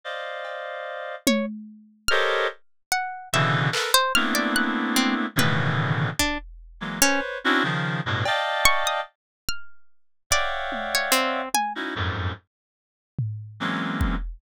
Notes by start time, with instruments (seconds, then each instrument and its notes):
0.04 clarinet C5 D5 D#5 F5
0.45 cowbell
1.27 pizzicato strings C#5, high tom
2.08 clarinet G4 A4 A#4 C5 C#5 D#5, pizzicato strings F6
2.92 pizzicato strings F#5
3.33 clarinet B2 C#3 D3 E3, pizzicato strings E5
3.72 clarinet A4 A#4 B4, clap
3.94 pizzicato strings C5
4.15 clarinet A3 A#3 B3 C4 D4 E4, pizzicato strings F6
4.35 pizzicato strings D5
4.56 pizzicato strings F#6
4.96 pizzicato strings C4, high tom
5.36 clarinet A2 B2 C#3 D3 D#3 E3, pizzicato strings B4, high tom
6.19 pizzicato strings D4, kick
6.80 clarinet E3 F#3 G#3 A#3
7.01 pizzicato strings C#4, clarinet B4 C5 C#5
7.44 clarinet C4 C#4 D4 E4 F#4
7.63 clarinet C#3 D#3 F3
8.06 clarinet G2 A2 B2
8.25 clarinet D5 D#5 F5 G5 A5, cowbell
8.65 pizzicato strings C#6
8.87 pizzicato strings D#6
9.49 pizzicato strings F6
10.30 clarinet C#5 D5 E5 F5 F#5 G5, pizzicato strings D5, kick
10.72 high tom
10.95 pizzicato strings C#5
11.12 pizzicato strings C4, closed hi-hat
11.54 pizzicato strings G#5, high tom
11.75 clarinet C#4 D#4 E4 F#4
11.95 clarinet F2 F#2 G#2
13.18 floor tom
13.60 clarinet E3 F#3 G#3 A#3 C4 C#4
14.01 kick